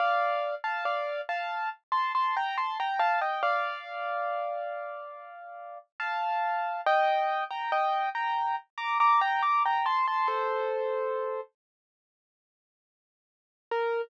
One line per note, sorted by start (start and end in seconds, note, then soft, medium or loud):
0.00 0.55 D5 medium
0.00 0.55 F5 loud
0.64 0.84 F5 medium
0.64 0.84 A5 medium
0.85 1.21 D5 medium
0.85 1.21 F5 medium
1.29 1.69 F5 medium
1.29 1.69 A5 medium
1.92 2.12 A5 medium
1.92 2.12 C6 medium
2.15 2.35 A5 medium
2.15 2.35 C6 medium
2.37 2.57 G5 medium
2.37 2.57 A#5 medium
2.58 2.78 A5 medium
2.58 2.78 C6 medium
2.80 3.00 G5 medium
2.80 3.00 A#5 medium
2.99 3.20 F5 medium
2.99 3.20 A5 loud
3.21 3.42 D#5 medium
3.21 3.42 G5 medium
3.43 5.78 D5 medium
3.43 5.78 F5 loud
6.00 6.81 F5 medium
6.00 6.81 A5 medium
6.86 7.44 D#5 loud
6.86 7.44 G5 loud
7.51 7.71 G5 medium
7.51 7.71 A#5 medium
7.72 8.09 D#5 medium
7.72 8.09 G5 loud
8.15 8.56 G5 medium
8.15 8.56 A#5 medium
8.78 8.98 A#5 medium
8.78 8.98 D6 medium
9.00 9.21 A#5 medium
9.00 9.21 D6 medium
9.21 9.42 G5 medium
9.21 9.42 A#5 loud
9.43 9.63 A#5 medium
9.43 9.63 D6 medium
9.66 9.86 G5 medium
9.66 9.86 A#5 medium
9.86 10.06 A5 medium
9.86 10.06 C6 medium
10.08 10.28 A5 medium
10.08 10.28 C6 medium
10.28 11.41 A4 medium
10.28 11.41 C5 medium
13.71 14.01 A#4 loud